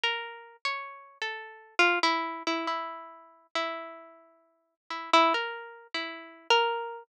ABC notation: X:1
M:2/4
L:1/16
Q:1/4=68
K:none
V:1 name="Harpsichord"
(3_B4 _d4 A4 | F E2 E E4 | E6 E E | (3_B4 E4 B4 |]